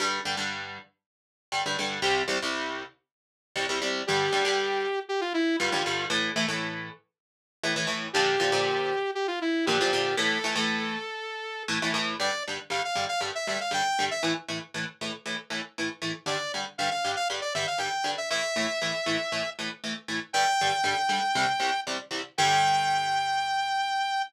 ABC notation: X:1
M:4/4
L:1/16
Q:1/4=118
K:Gdor
V:1 name="Lead 2 (sawtooth)"
z16 | z16 | G8 G F E2 F4 | z16 |
G8 G F E2 G4 | A12 z4 | d2 z2 f f2 f z e e f g3 e | z16 |
d2 z2 f f2 f z d e f g3 e | e10 z6 | g12 z4 | g16 |]
V:2 name="Overdriven Guitar"
[G,,D,G,]2 [G,,D,G,] [G,,D,G,]9 [G,,D,G,] [G,,D,G,] [G,,D,G,]2 | [C,,C,G,]2 [C,,C,G,] [C,,C,G,]9 [C,,C,G,] [C,,C,G,] [C,,C,G,]2 | [G,,D,G,]2 [G,,D,G,] [G,,D,G,]9 [G,,D,G,] [G,,D,G,] [G,,D,G,]2 | [A,,E,A,]2 [A,,E,A,] [A,,E,A,]9 [A,,E,A,] [A,,E,A,] [A,,E,A,]2 |
[B,,D,F,]2 [B,,D,F,] [B,,D,F,]9 [B,,D,F,] [B,,D,F,] [B,,D,F,]2 | [A,,E,A,]2 [A,,E,A,] [A,,E,A,]9 [A,,E,A,] [A,,E,A,] [A,,E,A,]2 | [G,,D,G,]2 [G,,D,G,]2 [G,,D,G,]2 [G,,D,G,]2 [G,,D,G,]2 [G,,D,G,]2 [G,,D,G,]2 [G,,D,G,]2 | [A,,E,A,]2 [A,,E,A,]2 [A,,E,A,]2 [A,,E,A,]2 [A,,E,A,]2 [A,,E,A,]2 [A,,E,A,]2 [A,,E,A,]2 |
[G,,D,G,]2 [G,,D,G,]2 [G,,D,G,]2 [G,,D,G,]2 [G,,D,G,]2 [G,,D,G,]2 [G,,D,G,]2 [G,,D,G,]2 | [A,,E,A,]2 [A,,E,A,]2 [A,,E,A,]2 [A,,E,A,]2 [A,,E,A,]2 [A,,E,A,]2 [A,,E,A,]2 [A,,E,A,]2 | [G,,D,G,]2 [G,,D,G,]2 [G,,D,G,]2 [G,,D,G,]2 [C,,C,G,]2 [C,,C,G,]2 [C,,C,G,]2 [C,,C,G,]2 | [G,,D,G,]16 |]